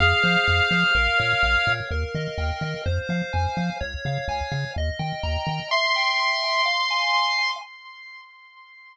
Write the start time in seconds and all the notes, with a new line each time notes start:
0.00 F2 G#4 F5
0.23 F3 C5
0.47 F2 F5
0.71 F3 C5
0.95 A#1 A#4
1.18 A#2 C#5
1.43 A#1 F5
1.67 A#2 C#5
1.91 D#2 A#4
2.15 D#3 D#5
2.38 D#2 G5
2.61 D#3 D#5
2.86 F2 C5
3.09 F3 F5
3.33 F2 G#5
3.57 F3 F5
3.81 C#2 C#5
4.05 C#3 F5
4.28 C#2 G#5
4.52 C#3 F5
4.76 D#2 D#5
4.99 D#3 G5
5.23 D#2 A#5
5.47 D#3 G5
5.71 E5 C6
5.96 G5
6.20 C6
6.44 G5
6.65 F5
6.90 G#5
7.14 C6
7.38 G#5